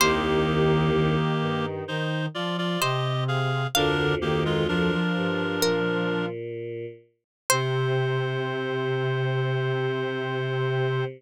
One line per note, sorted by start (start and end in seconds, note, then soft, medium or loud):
0.00 1.16 C2 medium
0.00 1.16 D#2 loud
0.00 0.90 D#3 loud
0.00 1.66 A#3 loud
0.00 1.66 G4 loud
0.00 2.56 C5 medium
0.95 1.85 D#3 medium
1.41 1.82 G2 medium
1.88 2.28 D#3 medium
1.88 2.26 D#4 medium
1.88 2.26 C5 loud
2.34 2.77 F3 medium
2.34 2.57 F4 medium
2.34 2.57 D5 loud
2.58 2.80 F4 medium
2.58 2.80 D5 loud
2.81 3.67 C3 medium
2.81 3.24 G4 medium
2.81 3.59 C5 medium
2.81 3.24 D#5 loud
3.28 3.67 G#4 medium
3.28 3.67 F5 loud
3.75 4.92 D2 medium
3.75 4.92 F2 medium
3.75 4.14 D3 medium
3.75 4.15 D4 loud
3.75 4.15 A#4 loud
3.75 5.48 F5 medium
4.21 4.64 D#3 medium
4.21 4.44 A#3 medium
4.21 4.44 G4 loud
4.45 4.67 G#3 loud
4.45 4.67 F4 loud
4.68 4.90 F3 medium
4.68 6.26 D4 loud
4.68 6.26 A#4 loud
4.92 6.29 F3 medium
5.16 5.59 G2 medium
5.62 6.86 A#2 medium
5.62 6.76 A#4 medium
7.50 11.05 C3 loud
7.50 11.04 C5 loud